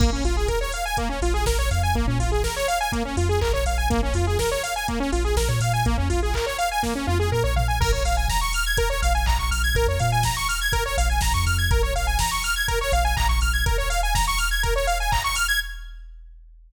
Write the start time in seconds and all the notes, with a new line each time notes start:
0.00 A#1 A#3, kick, crash
0.12 A#1 C#4
0.24 A#1 F4, open hi-hat
0.37 G#4
0.48 A#4, kick, closed hi-hat
0.61 C#5
0.72 F5, open hi-hat
0.85 G#5
0.97 A#3, kick, closed hi-hat
1.09 C#4
1.22 A#1 F4, open hi-hat
1.34 G#4
1.46 A#1 A#4, kick, snare
1.58 A#1 C#5
1.71 F2 F5, open hi-hat
1.83 G#5
1.94 A#1 A#3, kick, closed hi-hat
2.07 A#2 C#4
2.19 A#1 F4, open hi-hat
2.32 G#4
2.43 A#4, kick, snare
2.56 C#5
2.68 F5, open hi-hat
2.81 G#5
2.92 A#3, kick, closed hi-hat
3.05 C#4
3.17 F2 F4, open hi-hat
3.29 G#4
3.41 A#1 A#4, kick, clap
3.53 A#1 C#5
3.66 A#1 F5, open hi-hat
3.78 G#5
3.90 A#1 A#3, kick, closed hi-hat
4.03 A#1 C#4
4.14 F2 F4, open hi-hat
4.27 G#4
4.39 A#4, kick, snare
4.51 C#5
4.63 F5, open hi-hat
4.76 G#5
4.88 A#3, kick, closed hi-hat
5.00 C#4
5.12 A#1 F4, open hi-hat
5.24 G#4
5.36 A#1 A#4, kick, snare
5.48 A#2 C#5
5.60 A#2 F5, open hi-hat
5.73 G#5
5.85 A#1 A#3, kick, closed hi-hat
5.98 F2 C#4
6.10 A#1 F4, open hi-hat
6.23 G#4
6.34 A#4, kick, clap
6.46 C#5
6.58 F5, open hi-hat
6.71 G#5
6.83 A#3, kick, snare
6.95 C#4
7.07 F2 F4, high tom
7.20 G#4
7.32 A#2 A#4
7.44 A#1 C#5
7.56 A#1 F5, floor tom
7.68 G#5
7.80 A#1 A#4, kick, crash
7.92 A#1 C#5
8.05 A#1 F5, open hi-hat
8.17 G#5
8.28 A#5, kick, snare
8.41 C#6
8.53 F6, open hi-hat
8.66 G#6
8.77 A#4, kick, closed hi-hat
8.90 C#5
9.02 A#1 F5, open hi-hat
9.15 G#5
9.26 A#1 A#5, kick, clap
9.39 A#1 C#6
9.51 A#1 F6, open hi-hat
9.64 G#6
9.75 A#1 A#4, kick, closed hi-hat
9.87 F2 C#5
9.99 A#2 F5, open hi-hat
10.12 G#5
10.23 A#5, kick, snare
10.37 C#6
10.49 F6, open hi-hat
10.61 G#6
10.72 A#4, kick, closed hi-hat
10.86 C#5
10.98 A#1 F5, open hi-hat
11.10 G#5
11.21 A#1 A#5, kick, snare
11.34 F2 C#6
11.46 F2 F6, open hi-hat
11.58 G#6
11.71 A#1 A#4, kick, closed hi-hat
11.83 A#1 C#5
11.95 A#1 F5, open hi-hat
12.07 G#5
12.19 A#5, kick, snare
12.31 C#6
12.43 F6, open hi-hat
12.56 G#6
12.68 A#4, kick, closed hi-hat
12.81 C#5
12.92 A#1 F5, open hi-hat
13.05 G#5
13.17 A#1 A#5, kick, clap
13.29 A#1 C#6
13.41 A#1 F6, open hi-hat
13.53 G#6
13.66 A#4, kick, closed hi-hat
13.78 C#5
13.90 F5, open hi-hat
14.03 G#5
14.15 A#5, kick, snare
14.27 C#6
14.38 F6, open hi-hat
14.51 G#6
14.63 A#4, kick, closed hi-hat
14.76 C#5
14.87 F5, open hi-hat
15.00 G#5
15.12 A#5, kick, clap
15.24 C#6
15.35 F6, open hi-hat
15.48 G#6